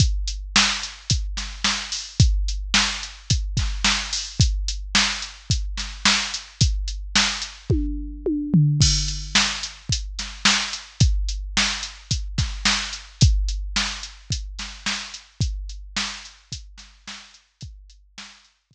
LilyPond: \new DrumStaff \drummode { \time 4/4 \tempo 4 = 109 <hh bd>8 hh8 sn8 hh8 <hh bd>8 <hh sn>8 sn8 hho8 | <hh bd>8 hh8 sn8 hh8 <hh bd>8 <hh bd sn>8 sn8 hho8 | <hh bd>8 hh8 sn8 hh8 <hh bd>8 <hh sn>8 sn8 hh8 | <hh bd>8 hh8 sn8 hh8 <bd tommh>4 tommh8 tomfh8 |
<cymc bd>8 hh8 sn8 hh8 <hh bd>8 <hh sn>8 sn8 hh8 | <hh bd>8 hh8 sn8 hh8 <hh bd>8 <hh bd sn>8 sn8 hh8 | <hh bd>8 hh8 sn8 hh8 <hh bd>8 <hh sn>8 sn8 hh8 | <hh bd>8 hh8 sn8 hh8 <hh bd>8 <hh sn>8 sn8 hh8 |
<hh bd>8 hh8 sn8 hh8 <hh bd>4 r4 | }